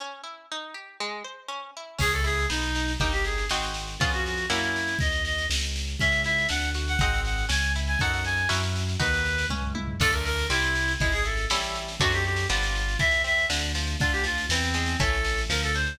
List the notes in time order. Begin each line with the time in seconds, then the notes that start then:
0.00 C#4
0.23 E4
0.51 D#4
0.74 G4
1.00 G#3
1.24 C5
1.48 C#4
1.77 E4
1.98 C#2 C#4 G#4, kick, snare, crash
2.12 A4, snare
2.24 E4 G#4, snare
2.38 snare
2.50 B1 B3 D#4, snare
2.62 snare
2.75 D#4, snare
2.88 snare
3.00 G1 A#3 D#4 G4, kick, snare
3.13 G4, snare
3.24 G#4, snare
3.38 snare
3.49 G#1 C4 D#4 F#4 G#4, snare
3.63 snare
3.74 snare
3.88 snare
3.99 F2 B3 C#4 F4 G#4, kick, snare
4.12 F#4, snare
4.25 F#4, snare
4.37 snare
4.50 F#2 A#3 C#4 E4 F#4, snare
4.63 snare
4.76 snare
4.88 snare
4.99 D#2 D#5, kick, snare
5.12 snare
5.25 D#5, snare
5.38 snare
5.50 C#2, snare
5.61 snare
5.76 snare
5.88 snare
5.99 C#2 C#4 E5, kick, snare
6.12 snare
6.24 E4 E5, snare
6.38 snare
6.49 D2 D4 F#5, snare
6.62 snare
6.74 F#4, snare
6.88 F#5, snare
6.99 G#1 C4 D#4 F#4 G#4 F#5, kick, snare
7.14 snare
7.25 F#5, snare
7.38 snare
7.49 C#2 C#4 G#5, snare
7.62 snare
7.76 E4, snare
7.87 G#5, snare
7.99 F#2 D#4 F#4 A4 F#5, kick, snare
8.12 F#5, snare
8.24 G#5, snare
8.37 snare
8.49 F#2 C#4 E4 F#4 A#4, snare
8.63 snare
8.76 snare
8.89 snare
8.99 D#2 D#4 F#4 B4, kick, snare
9.14 snare
9.25 snare
9.38 snare
9.49 C#2 C#4, kick, high tom
9.62 floor tom
9.75 E4, high tom
9.88 floor tom
10.00 D2 A3 D4 F4 A4, kick, snare, crash
10.12 A#4, snare
10.25 A#4, snare
10.38 snare
10.50 C2 G3 C4 E4, snare
10.62 snare
10.75 snare
10.88 snare
11.00 G#1 G#3 E4, kick, snare
11.12 G#4, snare
11.24 E4 A4, snare
11.37 snare
11.50 A1 G3 A3 C#4 E4, snare
11.62 snare
11.75 snare
11.88 snare
12.00 F#2 F#3 A3 C4 D4 F#4, kick, snare
12.12 G4, snare
12.25 G4, snare
12.36 snare
12.49 G1 F3 G3 B3 D4 F4, snare
12.63 snare
12.75 snare
12.88 snare
12.99 E2 E3 E5, kick, snare
13.11 snare
13.24 C4 E5, snare
13.38 snare
13.50 D2 D3, snare
13.62 snare
13.75 F3, snare
13.87 snare
13.99 D2 D3 F4, kick, snare
14.12 G4, snare
14.24 F3 F4, snare
14.38 snare
14.49 E2 E3 C4, snare
14.63 snare
14.74 G#3, snare
14.86 snare
15.00 A1 E3 A3 C#4 A4, kick, snare
15.13 snare
15.24 snare
15.38 snare
15.49 D2 F3 A#4, snare
15.63 A4, snare
15.74 D4 C5, snare
15.86 snare